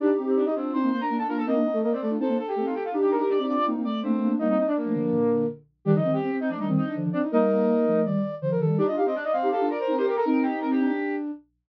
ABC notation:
X:1
M:4/4
L:1/16
Q:1/4=164
K:Gm
V:1 name="Flute"
[Dd] z2 [Cc] [Dd] [Ee] [Cc]2 [cc']2 [cc'] [Bb]2 [Aa] [Bb] [Aa] | [B,B] z2 [A,A] [B,B] [Cc] [A,A]2 [Aa]2 [Aa] [Gg]2 [Ff] [Gg] [Ff] | z [Gg] [Bb] [Bb] [dd']2 [dd']2 z2 [dd']2 [Cc]4 | [Ee] [Ee] [Ee] [Dd] [B,B]8 z4 |
[Dd] [Ee]2 [Gg]3 [Ee] [Dd] [Ee] z [Ee]2 z2 [Dd] z | [Ee]8 z8 | [Dd] z2 [Cc] [Dd] [Ee] [Cc]2 [Aa]2 [Bb] [Bb]2 [cc'] [Gg] [Bb] | [Bb]2 [Gg]2 [Bb] [Gg]5 z6 |]
V:2 name="Flute"
D2 C3 z3 D B, B, D D D F z | e4 e d d z c c A2 A4 | D4 D C C z B, B, A,2 A,4 | B, C2 D9 z4 |
G E C2 C C C z D C2 D3 C E | B8 d4 c B A2 | d e f e d2 f2 f2 d c2 B B A | E6 D6 z4 |]
V:3 name="Ocarina"
[EG]6 [DF]2 [CE] [CE] z2 [B,D] [B,D] [B,D]2 | [CE] [B,D] [CE] z4 [DF] [CE] [B,D] z2 [A,C] [CE] z2 | [EG]6 [DF]2 [CE] [CE] z2 [B,D] [B,D] [B,D]2 | [G,B,]2 z3 [F,A,] [D,F,]2 [B,,D,]4 z4 |
[E,G,] [D,F,] [E,G,] z4 [F,A,] [E,G,] [E,G,] z2 [D,F,] [D,F,] z2 | [G,B,]6 [F,A,]2 [E,G,] [E,G,] z2 [D,F,] [D,F,] [E,G,]2 | [EG] [DF] [EG] z4 [EG] [EG] [DF] z2 [CE] [EG] z2 | [CE]8 z8 |]